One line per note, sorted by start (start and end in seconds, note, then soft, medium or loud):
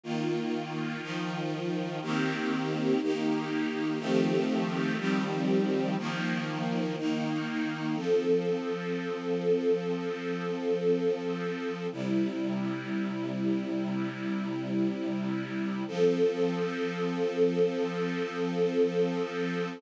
0.04 1.01 D#3 medium
0.04 1.02 A#3 medium
0.04 1.01 F4 medium
1.02 2.00 D#3 medium
1.02 2.00 F3 medium
1.02 2.00 F4 medium
2.02 3.00 D#3 loud
2.02 3.00 A#3 medium
2.02 3.00 C4 medium
2.02 3.00 G4 medium
3.02 3.99 D#3 medium
3.02 4.00 A#3 medium
3.02 4.00 D#4 medium
3.02 3.99 G4 medium
3.99 4.97 D#3 medium
3.99 4.97 F3 medium
3.99 4.97 A3 medium
3.99 4.97 C4 medium
3.99 4.97 G4 medium
4.98 5.96 D#3 medium
4.98 5.96 F3 medium
4.98 5.96 G3 medium
4.98 5.96 C4 medium
4.98 5.96 G4 medium
5.98 6.96 D#3 medium
5.98 6.96 F3 loud
5.98 6.96 A#3 medium
6.98 7.96 D#3 medium
6.98 7.96 A#3 medium
6.98 7.96 D#4 medium
7.96 11.87 F3 medium
7.96 11.87 C4 medium
7.96 11.87 A4 medium
11.92 15.84 C3 medium
11.92 15.84 G3 medium
11.92 15.84 E4 medium
15.88 19.79 F3 loud
15.88 19.79 C4 medium
15.88 19.79 A4 medium